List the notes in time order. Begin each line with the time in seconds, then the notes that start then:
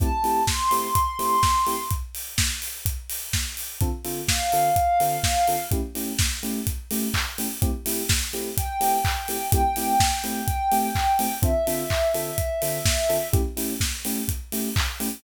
0.00 A3 C4 E4 G4 A5, kick, closed hi-hat
0.24 A3 C4 E4 G4, open hi-hat
0.47 C6, kick, snare
0.71 A3 C4 E4 G4, open hi-hat
0.95 kick, closed hi-hat
1.19 A3 C4 E4 G4, open hi-hat
1.43 kick, snare
1.67 A3 C4 E4 G4, open hi-hat
1.91 kick, closed hi-hat
2.15 open hi-hat
2.38 kick, snare
2.62 open hi-hat
2.86 kick, closed hi-hat
3.10 open hi-hat
3.33 kick, snare
3.57 open hi-hat
3.81 D3 C4 F4 A4, kick, closed hi-hat
4.05 D3 C4 F4 A4, open hi-hat
4.28 F5, kick, snare
4.52 D3 C4 F4 A4, open hi-hat
4.76 kick, closed hi-hat
5.00 D3 C4 F4 A4, open hi-hat
5.24 kick, snare
5.48 D3 C4 F4 A4, open hi-hat
5.71 A3 C#4 E4 G4, kick, closed hi-hat
5.95 A3 C#4 E4 G4, open hi-hat
6.19 kick, snare
6.43 A3 C#4 E4 G4, open hi-hat
6.67 kick, closed hi-hat
6.91 A3 C#4 E4 G4, open hi-hat
7.14 kick, clap
7.38 A3 C#4 E4 G4, open hi-hat
7.62 A3 C4 E4 G4, kick, closed hi-hat
7.86 A3 C4 E4 G4, open hi-hat
8.09 kick, snare
8.33 A3 C4 E4 G4, open hi-hat
8.57 G5, kick, closed hi-hat
8.81 A3 C4 E4 G4, open hi-hat
9.05 kick, clap
9.28 A3 C4 E4 G4, open hi-hat
9.52 A3 C4 E4 G4 G5, kick, closed hi-hat
9.76 A3 C4 E4 G4, open hi-hat
10.00 kick, snare
10.24 A3 C4 E4 G4, open hi-hat
10.48 kick, closed hi-hat
10.72 A3 C4 E4 G4, open hi-hat
10.95 kick, clap
11.19 A3 C4 E4 G4, open hi-hat
11.42 D3 C4 F4 A4 E5, kick, closed hi-hat
11.67 D3 C4 F4 A4, open hi-hat
11.90 kick, clap
12.14 D3 C4 F4 A4, open hi-hat
12.38 kick, closed hi-hat
12.62 D3 C4 F4 A4, open hi-hat
12.86 kick, snare
13.09 D3 C4 F4 A4, open hi-hat
13.33 A3 C#4 E4 G4, kick, closed hi-hat
13.57 A3 C#4 E4 G4, open hi-hat
13.80 kick, snare
14.05 A3 C#4 E4 G4, open hi-hat
14.28 kick, closed hi-hat
14.52 A3 C#4 E4 G4, open hi-hat
14.76 kick, clap
15.00 A3 C#4 E4 G4, open hi-hat